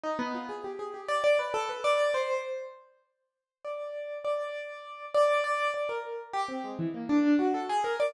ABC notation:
X:1
M:9/8
L:1/16
Q:3/8=67
K:none
V:1 name="Acoustic Grand Piano"
^D B, F ^G =G ^G =G =d d B A B d2 c2 z2 | z6 d4 d6 d2 | d2 d ^A z2 G C ^G, E, ^A, D2 ^F =A ^G ^A d |]